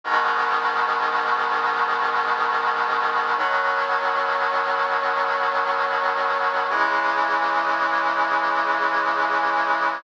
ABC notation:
X:1
M:4/4
L:1/8
Q:1/4=72
K:B
V:1 name="Brass Section" clef=bass
[G,,B,,D,]8 | [B,,D,F,]8 | [C,E,G,]8 |]